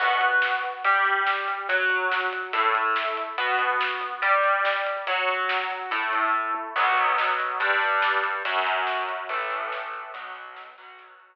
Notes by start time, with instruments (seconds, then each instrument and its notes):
0.00 overdriven guitar B3 F#4 B4, kick, crash
0.10 kick
0.21 kick, closed hi-hat
0.32 kick
0.42 kick, snare
0.52 kick
0.63 kick, closed hi-hat
0.74 kick
0.84 overdriven guitar G3 G4 D5, kick, closed hi-hat
0.95 kick
1.05 kick, closed hi-hat
1.16 kick
1.27 kick, snare
1.37 kick
1.47 kick, closed hi-hat
1.58 kick
1.69 overdriven guitar F#3 F#4 C#5, kick, closed hi-hat
1.79 kick
1.90 kick, closed hi-hat
2.01 kick
2.11 kick, snare
2.21 kick
2.33 kick, closed hi-hat
2.43 kick
2.53 overdriven guitar A3 E4 A4, kick, closed hi-hat
2.64 kick
2.75 kick, closed hi-hat
2.85 kick
2.96 kick, snare
3.07 kick
3.17 kick, closed hi-hat
3.28 kick
3.38 overdriven guitar B3 F#4 B4, kick, closed hi-hat
3.48 kick
3.59 kick, closed hi-hat
3.69 kick
3.80 kick, snare
3.90 kick
4.01 kick, closed hi-hat
4.12 kick
4.22 overdriven guitar G3 G4 D5, kick, closed hi-hat
4.34 kick
4.44 kick, closed hi-hat
4.55 kick
4.65 kick, snare
4.76 kick
4.86 kick, closed hi-hat
4.97 kick
5.07 overdriven guitar F#3 F#4 C#5, kick, closed hi-hat
5.18 kick
5.29 kick, closed hi-hat
5.39 kick
5.49 kick, snare
5.60 kick
5.70 kick, closed hi-hat
5.81 kick
5.91 overdriven guitar A3 E4 A4, kick, closed hi-hat
6.02 kick
6.13 kick, closed hi-hat
6.23 kick
6.34 kick, floor tom
6.54 high tom
6.76 overdriven guitar B2 F#3 B3, kick, crash
6.87 kick
6.97 kick, closed hi-hat
7.07 kick
7.18 kick, snare
7.29 kick
7.39 kick, closed hi-hat
7.50 kick
7.60 overdriven guitar G2 G3 D4, kick, closed hi-hat
7.71 kick
7.82 kick, closed hi-hat
7.92 kick
8.02 kick, snare
8.13 kick
8.24 kick, closed hi-hat
8.35 kick
8.45 overdriven guitar F#2 F#3 C#4, kick, closed hi-hat
8.56 kick
8.66 kick, closed hi-hat
8.77 kick
8.87 kick, snare
8.98 kick
9.08 kick, closed hi-hat
9.19 kick
9.29 overdriven guitar A2 E3 A3, kick, closed hi-hat
9.40 kick
9.51 kick, closed hi-hat
9.61 kick
9.72 kick, snare
9.83 kick
9.93 kick, closed hi-hat
10.04 kick
10.14 overdriven guitar B2 F#3 B3, kick, closed hi-hat
10.25 kick
10.35 kick, closed hi-hat
10.46 kick
10.56 kick, snare
10.67 kick
10.78 overdriven guitar B2 F#3 B3, kick, closed hi-hat
10.88 kick
10.99 kick, closed hi-hat
11.09 kick
11.19 kick, closed hi-hat
11.30 kick